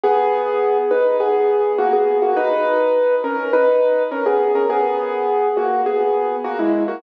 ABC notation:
X:1
M:4/4
L:1/16
Q:1/4=103
K:B
V:1 name="Acoustic Grand Piano"
[B,G]6 [DB]2 [B,G]4 [A,F] [B,G]2 [A,F] | [DB]6 [CA]2 [DB]4 [CA] [B,G]2 [CA] | [B,G]6 [A,F]2 [B,G]4 [A,F] [G,E]2 [A,F] |]